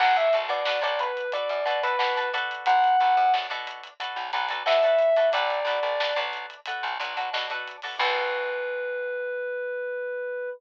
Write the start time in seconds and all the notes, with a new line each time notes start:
0.00 B1 D4 F#4 A4 B4 F#5, kick, crash
0.16 E5, kick, closed hi-hat
0.33 B1 D4 F#4 A4 B4, closed hi-hat
0.49 B2 D5, closed hi-hat
0.65 D4 F#4 A4 B4, snare
0.82 B1 D4 F#4 A4 B4 D5, closed hi-hat
0.99 B4, closed hi-hat
1.17 closed hi-hat
1.32 D4 F#4 A4 B4 D5, kick, closed hi-hat
1.49 F#2, closed hi-hat
1.65 B2 D4 F#4 A4 B4, closed hi-hat
1.83 D4 F#4 A4 B4, closed hi-hat
1.99 B2 D4 F#4 A4 B4, snare
2.17 D4 F#4 A4 B4, kick, closed hi-hat
2.33 D4 F#4 A4 B4, closed hi-hat
2.51 closed hi-hat
2.66 B1 F#5, kick, closed hi-hat
2.84 closed hi-hat
3.00 B1 D4 F#4 A4 B4, closed hi-hat
3.17 F#2, closed hi-hat
3.33 D4 F#4 A4 B4, snare
3.50 B2 D4 F#4 A4 B4, closed hi-hat
3.67 closed hi-hat
3.83 closed hi-hat
4.00 D4 F#4 A4 B4, kick, closed hi-hat
4.16 B1, closed hi-hat
4.32 B1 D4 F#4 A4 B4, kick, snare, closed hi-hat
4.49 D4 F#4 A4 B4, closed hi-hat
4.66 B2 D4 F#4 A4 B4 E5, snare
4.83 D4 F#4 A4 B4, kick, closed hi-hat
4.99 closed hi-hat
5.16 D4 F#4 A4 B4, closed hi-hat
5.32 B1 D4 F#4 A4 B4 D5, kick, closed hi-hat
5.50 closed hi-hat
5.65 B1 D4 F#4 A4 B4, snare, closed hi-hat
5.83 B1, closed hi-hat
6.00 D4 F#4 A4 B4, snare
6.16 B1 D4 F#4 A4 B4, closed hi-hat
6.33 closed hi-hat
6.50 closed hi-hat
6.66 D4 F#4 A4 B4, kick, closed hi-hat
6.83 B1, closed hi-hat
6.99 B1 D4 F#4 A4 B4, closed hi-hat
7.17 D4 F#4 A4 B4, closed hi-hat
7.33 B2 D4 F#4 A4 B4, snare
7.50 D4 F#4 A4 B4, kick, closed hi-hat
7.68 closed hi-hat
7.82 D4 F#4 A4 B4, open hi-hat
7.99 B1 D4 F#4 A4 B4, kick, crash